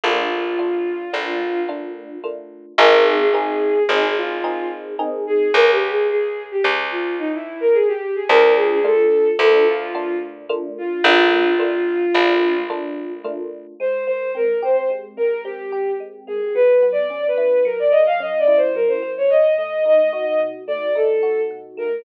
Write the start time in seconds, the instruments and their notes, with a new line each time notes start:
0.04 electric bass (finger) A#1, electric piano 1 A3 A#3 D4 F4, violin F4
0.59 electric piano 1 A3 A#3 D4 F4
1.13 electric bass (finger) A#1, electric piano 1 A3 A#3 D4 F4
1.69 electric piano 1 A3 A#3 D4 F4
2.24 electric piano 1 A3 A#3 D4 F4
2.78 electric bass (finger) G#1, electric piano 1 A#3 C4 D#4 G#4, violin A#4
3.06 violin G#4
3.20 violin G#4
3.34 electric piano 1 A#3 C4 D#4 G#4, violin G#4
3.88 electric bass (finger) G#1, electric piano 1 A#3 C4 D#4 G#4, violin G#4
4.17 violin F4
4.44 electric piano 1 A#3 C4 D#4 G#4
4.99 electric piano 1 A#3 C4 D#4 G#4
5.27 violin G#4
5.54 electric bass (finger) C#2, violin A#4
5.72 violin G4
5.90 violin G#4
6.10 violin G#4
6.51 violin G4
6.64 electric bass (finger) C#2
6.91 violin F4
7.19 violin D#4
7.34 violin E4
7.61 violin A#4
7.74 violin G#4
7.88 violin G4
8.15 violin G#4
8.29 electric bass (finger) D2, electric piano 1 A3 A#3 D4 F4, violin A#4
8.56 violin G#4
8.72 violin G#4
8.84 electric piano 1 A3 A#3 D4 F4, violin A4
9.39 electric bass (finger) D2, electric piano 1 A3 A#3 D4 F4, violin A4
9.68 violin F4
9.95 electric piano 1 A3 A#3 D4 F4
10.49 electric piano 1 A3 A#3 D4 F4
10.78 violin F4
11.04 electric bass (finger) A#1, electric piano 1 A3 A#3 D4 F4, violin F4
11.59 electric piano 1 A3 A#3 D4 F4
12.14 electric bass (finger) A#1, electric piano 1 A3 A#3 D4 F4
12.70 electric piano 1 A3 A#3 D4 F4
13.24 electric piano 1 A3 A#3 D4 F4
13.80 electric piano 1 G#3, violin C5
14.07 electric piano 1 A#3, violin C5
14.35 electric piano 1 C4, violin A#4
14.63 electric piano 1 G4, violin C5
14.76 violin C5
14.90 electric piano 1 G#3
15.17 electric piano 1 A#3, violin A#4
15.44 electric piano 1 C4, violin G4
15.72 electric piano 1 G4
16.00 electric piano 1 G#3
16.27 electric piano 1 A#3, violin G#4
16.55 electric piano 1 F#3, violin B4
16.82 electric piano 1 B3
16.92 violin D5
17.10 electric piano 1 C#4
17.28 violin B4
17.38 electric piano 1 E4
17.65 electric piano 1 F#3, violin A#4
17.79 violin D5
17.91 electric piano 1 A#3, violin D#5
18.06 violin F5
18.20 electric piano 1 C#4, violin D#5
18.39 violin D5
18.47 electric piano 1 E4
18.57 violin C5
18.75 electric piano 1 F#3, violin A#4
18.88 violin C5
19.02 electric piano 1 A#3
19.18 violin C#5
19.30 electric piano 1 B2, violin D#5
19.58 electric piano 1 A3, violin D#5
19.85 electric piano 1 D#4, violin D#5
20.13 electric piano 1 F#4, violin D#5
20.26 violin D#5
20.40 electric piano 1 B2
20.67 electric piano 1 A3, violin D5
20.95 electric piano 1 D#4, violin A4
21.23 electric piano 1 F#4
21.51 electric piano 1 B2
21.77 electric piano 1 A3, violin A#4